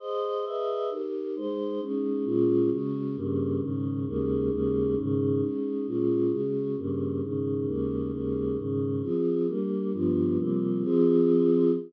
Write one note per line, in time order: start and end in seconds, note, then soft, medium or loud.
0.00 0.45 G#4 medium
0.00 0.45 C5 medium
0.00 0.45 D#5 medium
0.45 0.90 G#4 medium
0.45 0.90 B4 medium
0.45 0.90 D#5 medium
0.45 0.90 E5 medium
0.90 1.35 D#4 medium
0.90 1.35 G4 medium
0.90 1.35 A#4 medium
1.36 1.80 G#3 medium
1.36 1.80 D#4 medium
1.36 1.81 C5 medium
1.80 2.24 G#3 medium
1.80 2.24 C#4 medium
1.80 2.25 D#4 medium
2.25 2.70 A#2 medium
2.25 2.70 G#3 medium
2.25 2.70 C#4 medium
2.25 2.70 F4 medium
2.71 3.16 C#3 medium
2.71 3.16 G#3 medium
2.71 3.16 F#4 medium
3.16 3.61 G2 medium
3.16 3.61 C#3 medium
3.16 3.61 A#3 medium
3.61 4.06 G#2 medium
3.61 4.06 C#3 medium
3.61 4.06 D#3 medium
4.07 4.50 D#2 medium
4.07 4.50 C#3 medium
4.07 4.50 G#3 medium
4.07 4.50 A#3 medium
4.51 4.95 D#2 medium
4.51 4.95 C#3 medium
4.51 4.95 G#3 medium
4.51 4.95 A#3 medium
4.97 5.41 G#2 medium
4.97 5.41 C#3 medium
4.97 5.41 D#3 medium
5.41 5.86 G#3 medium
5.41 5.86 C#4 medium
5.41 5.86 D#4 medium
5.87 6.31 A#2 medium
5.87 6.30 G#3 medium
5.87 6.31 C#4 medium
5.87 6.31 F4 medium
6.31 6.76 C#3 medium
6.31 6.76 G#3 medium
6.31 6.76 F#4 medium
6.77 7.22 G2 medium
6.77 7.21 C#3 medium
6.77 7.22 A#3 medium
7.22 7.67 G#2 medium
7.22 7.66 C#3 medium
7.22 7.67 D#3 medium
7.67 8.11 D#2 medium
7.67 8.11 C#3 medium
7.67 8.11 G#3 medium
7.67 8.11 A#3 medium
8.12 8.57 D#2 medium
8.12 8.57 C#3 medium
8.12 8.57 G#3 medium
8.12 8.57 A#3 medium
8.57 9.02 G#2 medium
8.57 9.02 C#3 medium
8.57 9.02 D#3 medium
9.02 9.47 F3 medium
9.02 9.47 C4 medium
9.02 9.47 G#4 medium
9.48 9.92 G3 medium
9.48 9.92 A#3 medium
9.48 9.92 D4 medium
9.93 10.37 G2 medium
9.93 10.37 F3 medium
9.93 10.37 B3 medium
9.93 10.37 D4 medium
10.38 10.83 C3 medium
10.38 10.83 F3 medium
10.38 10.83 G3 medium
10.38 10.83 A#3 medium
10.83 11.71 F3 loud
10.83 11.71 C4 loud
10.83 11.71 G#4 medium